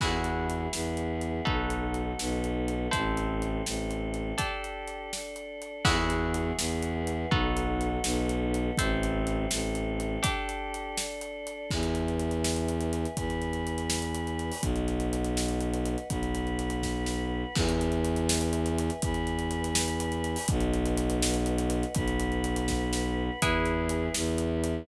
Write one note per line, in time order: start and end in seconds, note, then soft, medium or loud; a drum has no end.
0.00 0.68 E2 medium
0.00 0.72 B3 medium
0.00 0.72 E4 medium
0.00 1.45 E4 medium
0.00 0.72 F#4 medium
0.00 1.45 F#4 medium
0.00 0.72 G#4 medium
0.00 1.45 G#4 medium
0.00 1.45 B4 medium
0.00 kick loud
0.00 crash loud
0.24 closed hi-hat medium
0.50 closed hi-hat medium
0.73 1.41 E2 medium
0.73 1.45 B3 medium
0.73 1.46 E4 medium
0.73 1.46 G#4 medium
0.73 1.46 B4 medium
0.73 snare loud
0.97 closed hi-hat medium
1.21 closed hi-hat medium
1.45 2.14 B1 medium
1.45 2.18 B3 medium
1.45 2.89 D#4 medium
1.45 2.18 D#4 medium
1.45 2.89 F#4 medium
1.45 2.18 F#4 medium
1.45 2.89 A4 medium
1.45 2.18 A4 medium
1.45 2.89 B4 medium
1.45 kick loud
1.70 closed hi-hat medium
1.94 closed hi-hat medium
2.19 2.88 B1 medium
2.19 2.92 B3 medium
2.19 2.92 D#4 medium
2.19 2.92 A4 medium
2.19 2.92 B4 medium
2.19 snare loud
2.44 closed hi-hat medium
2.68 closed hi-hat medium
2.91 3.62 A1 medium
2.91 3.65 C4 medium
2.91 4.35 E4 medium
2.91 3.65 E4 medium
2.91 4.35 A4 medium
2.91 3.65 A4 medium
2.91 4.35 C5 medium
2.91 kick loud
2.91 closed hi-hat loud
3.17 closed hi-hat medium
3.42 closed hi-hat medium
3.66 4.33 A1 medium
3.66 4.39 A3 medium
3.66 4.39 C4 medium
3.66 4.38 A4 medium
3.66 snare loud
3.91 closed hi-hat medium
4.14 closed hi-hat medium
4.38 5.81 D4 medium
4.38 5.11 D4 medium
4.38 5.81 G4 medium
4.38 5.11 G4 medium
4.38 5.81 A4 medium
4.38 5.11 A4 medium
4.38 kick loud
4.38 closed hi-hat loud
4.64 closed hi-hat medium
4.88 closed hi-hat medium
5.12 5.85 D4 medium
5.12 5.85 A4 medium
5.12 5.85 D5 medium
5.12 snare loud
5.36 closed hi-hat medium
5.62 closed hi-hat medium
5.85 6.52 E2 medium
5.85 6.57 B3 medium
5.85 7.28 E4 medium
5.85 6.57 E4 medium
5.85 7.28 F#4 medium
5.85 6.57 F#4 medium
5.85 7.28 G#4 loud
5.85 6.57 G#4 medium
5.85 7.28 B4 loud
5.85 kick loud
5.85 crash loud
6.10 closed hi-hat medium
6.34 closed hi-hat loud
6.58 7.26 E2 medium
6.58 7.31 B3 medium
6.58 7.31 E4 medium
6.58 7.31 G#4 medium
6.58 7.31 B4 medium
6.58 snare loud
6.83 closed hi-hat medium
7.07 closed hi-hat medium
7.31 7.99 B1 medium
7.31 8.04 B3 medium
7.31 8.75 D#4 medium
7.31 8.04 D#4 medium
7.31 8.75 F#4 medium
7.31 8.05 F#4 medium
7.31 8.75 A4 medium
7.31 8.04 A4 medium
7.31 8.75 B4 medium
7.31 kick loud
7.57 closed hi-hat medium
7.81 closed hi-hat medium
8.03 8.71 B1 medium
8.03 8.77 B3 medium
8.03 8.77 D#4 medium
8.03 8.77 A4 medium
8.03 8.77 B4 medium
8.03 snare loud
8.29 closed hi-hat medium
8.54 closed hi-hat medium
8.77 9.46 A1 medium
8.77 9.50 C4 loud
8.77 9.50 E4 medium
8.77 10.22 E4 medium
8.77 9.50 A4 medium
8.77 10.22 A4 loud
8.77 10.22 C5 medium
8.77 kick loud
8.77 closed hi-hat loud
9.03 closed hi-hat medium
9.27 closed hi-hat medium
9.51 10.18 A1 medium
9.51 10.24 A3 medium
9.51 10.24 C4 medium
9.51 10.24 A4 medium
9.51 snare loud
9.75 closed hi-hat medium
10.00 closed hi-hat medium
10.23 11.66 D4 medium
10.23 10.97 D4 medium
10.23 11.66 G4 loud
10.23 10.97 G4 medium
10.23 11.66 A4 medium
10.23 10.97 A4 medium
10.23 kick loud
10.23 closed hi-hat loud
10.49 closed hi-hat medium
10.74 closed hi-hat medium
10.97 11.70 D4 medium
10.97 11.70 A4 medium
10.97 11.70 D5 medium
10.97 snare loud
11.21 closed hi-hat medium
11.47 closed hi-hat medium
11.71 13.06 E2 medium
11.71 13.16 B4 medium
11.71 13.16 E5 medium
11.71 13.16 G#5 medium
11.71 kick loud
11.71 crash loud
11.83 closed hi-hat medium
11.95 closed hi-hat medium
12.08 closed hi-hat medium
12.19 closed hi-hat medium
12.31 closed hi-hat medium
12.44 snare loud
12.56 closed hi-hat medium
12.68 closed hi-hat medium
12.81 closed hi-hat medium
12.93 closed hi-hat medium
13.05 closed hi-hat medium
13.17 14.51 E2 medium
13.17 14.62 B4 medium
13.17 14.62 G#5 medium
13.17 14.62 B5 medium
13.17 kick loud
13.17 closed hi-hat loud
13.30 closed hi-hat medium
13.42 closed hi-hat medium
13.53 closed hi-hat medium
13.67 closed hi-hat medium
13.78 closed hi-hat medium
13.90 snare loud
14.02 closed hi-hat medium
14.15 closed hi-hat loud
14.27 closed hi-hat medium
14.39 closed hi-hat medium
14.52 open hi-hat medium
14.62 15.96 B1 medium
14.62 16.08 B4 medium
14.62 16.08 D#5 medium
14.62 16.08 F#5 medium
14.62 kick loud
14.62 closed hi-hat loud
14.76 closed hi-hat medium
14.88 closed hi-hat medium
15.00 closed hi-hat medium
15.13 closed hi-hat loud
15.24 closed hi-hat medium
15.37 snare loud
15.48 closed hi-hat medium
15.61 closed hi-hat medium
15.73 closed hi-hat medium
15.85 closed hi-hat medium
15.98 closed hi-hat medium
16.10 17.44 B1 medium
16.10 17.55 B4 medium
16.10 17.55 F#5 medium
16.10 17.55 B5 medium
16.10 kick loud
16.10 closed hi-hat loud
16.23 closed hi-hat medium
16.35 closed hi-hat medium
16.47 closed hi-hat medium
16.59 closed hi-hat medium
16.70 closed hi-hat medium
16.83 kick medium
16.83 snare medium
17.06 snare medium
17.55 18.90 E2 medium
17.55 19.01 B4 medium
17.55 19.01 E5 medium
17.55 19.01 G#5 medium
17.55 kick loud
17.55 crash loud
17.69 closed hi-hat medium
17.81 closed hi-hat medium
17.92 closed hi-hat medium
18.04 closed hi-hat medium
18.16 closed hi-hat medium
18.29 snare loud
18.41 closed hi-hat medium
18.53 closed hi-hat loud
18.66 closed hi-hat medium
18.78 closed hi-hat loud
18.90 closed hi-hat medium
19.02 20.37 E2 medium
19.02 20.47 B4 medium
19.02 20.47 G#5 loud
19.02 20.47 B5 medium
19.02 kick loud
19.02 closed hi-hat loud
19.14 closed hi-hat medium
19.27 closed hi-hat medium
19.39 closed hi-hat medium
19.51 closed hi-hat medium
19.64 closed hi-hat medium
19.75 snare loud
19.88 closed hi-hat medium
20.00 closed hi-hat loud
20.12 closed hi-hat medium
20.24 closed hi-hat medium
20.36 open hi-hat medium
20.48 21.84 B1 medium
20.48 21.94 B4 medium
20.48 21.94 D#5 medium
20.48 21.94 F#5 medium
20.48 kick loud
20.48 closed hi-hat loud
20.60 closed hi-hat medium
20.73 closed hi-hat medium
20.86 closed hi-hat medium
20.97 closed hi-hat loud
21.10 closed hi-hat loud
21.22 snare loud
21.34 closed hi-hat medium
21.46 closed hi-hat loud
21.58 closed hi-hat medium
21.70 closed hi-hat loud
21.83 closed hi-hat medium
21.95 23.30 B1 medium
21.95 23.40 B4 medium
21.95 23.40 F#5 medium
21.95 23.40 B5 medium
21.95 kick loud
21.95 closed hi-hat loud
22.08 closed hi-hat medium
22.20 closed hi-hat loud
22.32 closed hi-hat medium
22.44 closed hi-hat loud
22.56 closed hi-hat loud
22.68 kick medium
22.68 snare loud
22.93 snare loud
23.41 24.09 E2 medium
23.41 24.14 E4 medium
23.41 24.86 E4 loud
23.41 24.14 G#4 medium
23.41 24.86 G#4 medium
23.41 24.14 B4 medium
23.41 24.86 B4 medium
23.41 kick loud
23.41 closed hi-hat loud
23.66 closed hi-hat medium
23.89 closed hi-hat loud
24.14 24.83 E2 medium
24.14 24.87 E4 medium
24.14 24.87 B4 medium
24.14 24.87 E5 medium
24.14 snare loud
24.38 closed hi-hat loud
24.64 closed hi-hat loud